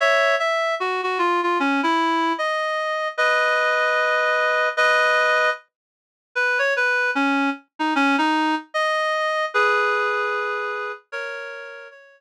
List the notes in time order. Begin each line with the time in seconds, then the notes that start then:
0.00 C#5 E5
0.39 E5
0.80 F#4
1.03 F#4
1.19 F4
1.43 F4
1.60 C#4
1.83 E4
2.38 D#5
3.18 B4 D#5
4.77 B4 D#5
6.35 B4
6.59 C#5
6.76 B4
7.15 C#4
7.79 D#4
7.95 C#4
8.18 D#4
8.74 D#5
9.54 G#4 B4
11.12 A#4 C#5
11.91 C#5